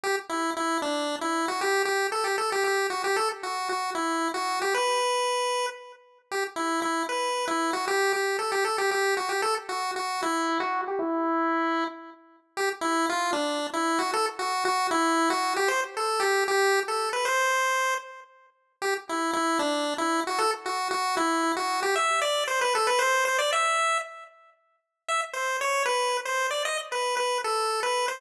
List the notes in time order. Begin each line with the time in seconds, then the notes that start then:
0.03 G4
0.29 E4
0.57 E4
0.82 D4
1.21 E4
1.48 F#4
1.61 G4
1.85 G4
2.12 A4
2.24 G4
2.38 A4
2.52 G4
2.64 G4
2.90 F#4
3.04 G4
3.16 A4
3.43 F#4
3.69 F#4
3.95 E4
4.34 F#4
4.62 G4
4.74 B4
6.31 G4
6.56 E4
6.82 E4
7.09 B4
7.47 E4
7.73 F#4
7.88 G4
8.13 G4
8.39 A4
8.52 G4
8.64 A4
8.78 G4
8.91 G4
9.17 F#4
9.29 G4
9.42 A4
9.69 F#4
9.96 F#4
10.22 E4
10.60 F#4
10.87 G4
10.99 E4
12.57 G4
12.81 E4
13.09 F4
13.33 D4
13.73 E4
13.99 F#4
14.13 A4
14.39 F#4
14.65 F#4
14.91 E4
15.30 F#4
15.56 G4
15.68 C5
15.97 A4
16.20 G4
16.48 G4
16.88 A4
17.13 B4
17.25 C5
18.82 G4
19.09 E4
19.33 E4
19.59 D4
19.98 E4
20.27 F#4
20.38 A4
20.66 F#4
20.91 F#4
21.17 E4
21.57 F#4
21.82 G4
21.96 E5
22.22 D5
22.47 C5
22.61 B4
22.75 A4
22.87 B4
22.99 C5
23.25 C5
23.38 D5
23.52 E5
25.08 E5
25.33 C5
25.61 C#5
25.86 B4
26.25 C5
26.51 D5
26.65 D#5
26.92 B4
27.17 B4
27.44 A4
27.83 B4
28.08 C5